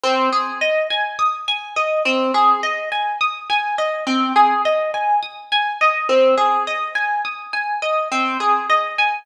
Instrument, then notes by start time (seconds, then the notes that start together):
orchestral harp
0.04 C4
0.32 G#4
0.61 D#5
0.90 G#5
1.19 D#6
1.48 G#5
1.76 D#5
2.05 C4
2.34 G#4
2.63 D#5
2.92 G#5
3.21 D#6
3.50 G#5
3.78 D#5
4.07 C4
4.36 G#4
4.65 D#5
4.94 G#5
5.23 D#6
5.52 G#5
5.81 D#5
6.09 C4
6.37 G#4
6.67 D#5
6.95 G#5
7.25 D#6
7.53 G#5
7.82 D#5
8.12 C4
8.40 G#4
8.70 D#5
8.98 G#5